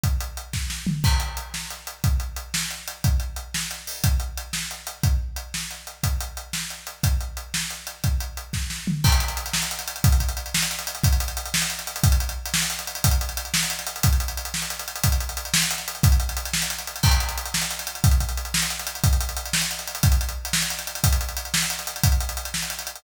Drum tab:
CC |------------|x-----------|------------|------------|
HH |x-x-x-------|--x-x---x-x-|x-x-x---x-x-|x-x-x---x-o-|
SD |------o-o---|------o-----|------o-----|------o-----|
FT |----------o-|------------|------------|------------|
BD |o-----o-----|o-----------|o-----------|o-----------|

CC |------------|------------|------------|------------|
HH |x-x-x---x-x-|x---x---x-x-|x-x-x---x-x-|x-x-x---x-x-|
SD |------o-----|------o-----|------o-----|------o-----|
FT |------------|------------|------------|------------|
BD |o-----------|o-----------|o-----------|o-----------|

CC |------------|x-----------|------------|------------|
HH |x-x-x-------|-xxxxx-xxxxx|xxxxxx-xxxxx|xxxxxx-xxxxx|
SD |------o-o---|------o-----|------o-----|------o-----|
FT |----------o-|------------|------------|------------|
BD |o-----o-----|o-----------|o-o---------|o-----------|

CC |------------|------------|------------|------------|
HH |xxxx-x-xxxxx|xxxxxx-xxxxx|xxxxxx-xxxxx|xxxxxx-xxxxx|
SD |------o-----|------o-----|------o-----|------o-----|
FT |------------|------------|------------|------------|
BD |o-----------|o-----------|o-----------|o-----------|

CC |------------|x-----------|------------|------------|
HH |xxxxxx-xxxxx|-xxxxx-xxxxx|xxxxxx-xxxxx|xxxxxx-xxxxx|
SD |------o-----|------o-----|------o-----|------o-----|
FT |------------|------------|------------|------------|
BD |o-----------|o-----------|o-o---------|o-----------|

CC |------------|------------|------------|
HH |xxxx-x-xxxxx|xxxxxx-xxxxx|xxxxxx-xxxxx|
SD |------o-----|------o-----|------o-----|
FT |------------|------------|------------|
BD |o-----------|o-----------|o-----------|